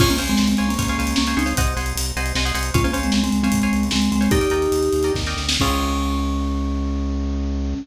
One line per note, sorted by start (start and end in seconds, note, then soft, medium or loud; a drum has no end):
0.00 0.18 C#2 loud
0.00 0.09 C#4 medium
0.00 0.09 F4 medium
0.00 0.17 C5 loud
0.00 0.17 C#5 loud
0.00 0.17 F5 loud
0.00 0.17 G#5 loud
0.00 kick loud
0.00 crash loud
0.10 0.19 A#3 medium
0.10 0.19 C#4 medium
0.10 closed hi-hat medium
0.18 0.37 C#2 medium
0.18 0.50 C5 loud
0.18 0.50 C#5 medium
0.18 0.50 F5 medium
0.18 0.50 G#5 medium
0.18 closed hi-hat loud
0.28 0.39 G#3 medium
0.28 0.39 C4 medium
0.28 closed hi-hat medium
0.37 0.56 C#2 medium
0.37 0.49 G#3 medium
0.37 0.49 C4 medium
0.37 snare loud
0.48 0.66 G#3 medium
0.48 0.66 C4 medium
0.48 closed hi-hat loud
0.57 0.77 C#2 medium
0.57 0.74 C5 medium
0.57 0.74 C#5 medium
0.57 0.74 F5 medium
0.57 0.74 G#5 medium
0.57 closed hi-hat medium
0.69 1.15 A#3 medium
0.69 1.15 C#4 medium
0.69 closed hi-hat loud
0.79 0.96 C#2 medium
0.79 0.86 C5 medium
0.79 0.86 C#5 medium
0.79 0.86 F5 loud
0.79 0.86 G#5 medium
0.79 kick loud
0.79 closed hi-hat loud
0.88 0.97 C5 medium
0.88 0.97 C#5 medium
0.88 0.97 F5 medium
0.88 0.97 G#5 medium
0.88 closed hi-hat medium
0.98 1.14 C#2 medium
0.98 1.22 C5 medium
0.98 1.22 C#5 medium
0.98 1.22 F5 medium
0.98 1.22 G#5 medium
0.98 closed hi-hat medium
1.07 closed hi-hat loud
1.16 1.35 C#2 medium
1.16 1.35 A#3 medium
1.16 1.35 C#4 medium
1.16 snare loud
1.27 1.35 C5 loud
1.27 1.35 C#5 medium
1.27 1.35 F5 medium
1.27 1.35 G#5 medium
1.27 closed hi-hat medium
1.37 1.54 C#2 medium
1.37 1.54 C4 medium
1.37 1.54 D#4 medium
1.37 1.45 C5 loud
1.37 1.45 C#5 medium
1.37 1.45 F5 medium
1.37 1.45 G#5 medium
1.37 closed hi-hat medium
1.46 1.54 C5 medium
1.46 1.54 C#5 loud
1.46 1.54 F5 medium
1.46 1.54 G#5 medium
1.46 closed hi-hat medium
1.57 1.74 C2 loud
1.57 1.73 C5 loud
1.57 1.73 D#5 loud
1.57 1.73 F#5 loud
1.57 1.73 G#5 loud
1.57 kick loud
1.57 closed hi-hat loud
1.67 closed hi-hat medium
1.76 1.93 C2 medium
1.76 2.08 C5 medium
1.76 2.08 D#5 medium
1.76 2.08 F#5 loud
1.76 2.08 G#5 medium
1.76 closed hi-hat medium
1.86 closed hi-hat medium
1.95 2.12 C2 medium
1.95 closed hi-hat loud
2.06 closed hi-hat medium
2.16 2.33 C2 medium
2.16 2.32 C5 medium
2.16 2.32 D#5 medium
2.16 2.32 F#5 loud
2.16 2.32 G#5 loud
2.16 closed hi-hat medium
2.26 closed hi-hat medium
2.35 2.52 C2 medium
2.35 2.44 C5 medium
2.35 2.44 D#5 loud
2.35 2.44 F#5 medium
2.35 2.44 G#5 loud
2.35 snare loud
2.45 2.53 C5 medium
2.45 2.53 D#5 medium
2.45 2.53 F#5 medium
2.45 2.53 G#5 loud
2.45 closed hi-hat medium
2.54 2.71 C2 medium
2.54 2.70 C5 medium
2.54 2.70 D#5 medium
2.54 2.70 F#5 medium
2.54 2.70 G#5 medium
2.54 closed hi-hat loud
2.63 closed hi-hat medium
2.74 2.91 C#2 loud
2.74 2.84 C#4 medium
2.74 2.84 F4 medium
2.74 2.82 C5 loud
2.74 2.82 C#5 loud
2.74 2.82 F5 loud
2.74 2.82 G#5 loud
2.74 kick loud
2.74 closed hi-hat loud
2.84 2.94 A#3 medium
2.84 2.94 C#4 medium
2.84 2.92 C5 loud
2.84 2.92 C#5 medium
2.84 2.92 F5 loud
2.84 2.92 G#5 loud
2.84 closed hi-hat medium
2.93 3.11 C#2 medium
2.93 3.25 C5 loud
2.93 3.25 C#5 medium
2.93 3.25 F5 loud
2.93 3.25 G#5 medium
2.93 closed hi-hat loud
3.03 3.13 G#3 medium
3.03 3.13 C4 medium
3.03 closed hi-hat medium
3.12 3.30 C#2 medium
3.12 3.23 G#3 medium
3.12 3.23 C4 medium
3.12 snare loud
3.24 3.41 G#3 medium
3.24 3.41 C4 medium
3.24 closed hi-hat medium
3.32 3.50 C#2 medium
3.32 closed hi-hat medium
3.43 3.84 G#3 medium
3.43 3.84 C4 medium
3.43 3.59 C5 medium
3.43 3.59 C#5 medium
3.43 3.59 F5 medium
3.43 3.59 G#5 medium
3.43 closed hi-hat medium
3.52 3.68 C#2 medium
3.52 kick loud
3.52 closed hi-hat loud
3.62 3.94 C5 medium
3.62 3.94 C#5 medium
3.62 3.94 F5 medium
3.62 3.94 G#5 medium
3.62 closed hi-hat medium
3.73 3.90 C#2 medium
3.73 closed hi-hat medium
3.83 closed hi-hat medium
3.91 4.10 C#2 medium
3.91 4.09 G#3 medium
3.91 4.09 C4 medium
3.91 snare loud
4.02 closed hi-hat medium
4.12 4.28 C#2 medium
4.12 4.31 G#3 medium
4.12 4.31 C4 medium
4.12 closed hi-hat medium
4.21 4.29 C5 medium
4.21 4.29 C#5 medium
4.21 4.29 F5 medium
4.21 4.29 G#5 loud
4.21 closed hi-hat medium
4.31 4.48 D#2 loud
4.31 5.13 D#4 medium
4.31 5.13 G4 loud
4.31 4.39 A#4 loud
4.31 4.39 D5 loud
4.31 4.39 D#5 loud
4.31 4.39 G5 loud
4.31 kick loud
4.31 closed hi-hat loud
4.41 4.49 A#4 medium
4.41 4.49 D5 loud
4.41 4.49 D#5 medium
4.41 4.49 G5 medium
4.41 closed hi-hat loud
4.50 4.68 D#2 medium
4.50 4.84 A#4 medium
4.50 4.84 D5 medium
4.50 4.84 D#5 medium
4.50 4.84 G5 medium
4.50 closed hi-hat loud
4.62 closed hi-hat medium
4.72 4.90 D#2 medium
4.72 closed hi-hat loud
4.83 closed hi-hat medium
4.93 5.11 D#2 medium
4.93 closed hi-hat medium
5.03 5.22 A#4 medium
5.03 5.22 D5 medium
5.03 5.22 D#5 medium
5.03 5.22 G5 loud
5.03 closed hi-hat medium
5.14 5.35 D#2 medium
5.14 kick loud
5.14 snare loud
5.26 5.55 A#4 medium
5.26 5.55 D5 medium
5.26 5.55 D#5 medium
5.26 5.55 G5 medium
5.26 snare medium
5.36 5.58 D2 medium
5.36 snare loud
5.49 snare loud
5.60 7.75 C#2 loud
5.60 7.75 C4 loud
5.60 7.74 C#4 loud
5.60 7.75 C#4 loud
5.60 7.75 F4 loud
5.60 7.75 G#4 loud
5.60 kick loud
5.60 crash loud